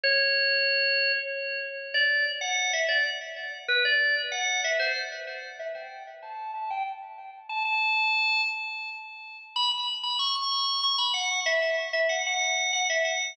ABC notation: X:1
M:12/8
L:1/8
Q:3/8=126
K:A
V:1 name="Drawbar Organ"
c7 z5 | d2 z f2 e d z4 B | d2 z f2 e =c z4 e | =g2 z a2 a g z4 a |
a5 z7 | [K:E] b b z b c' c'3 c' b f2 | e e z e f f3 f e f2 |]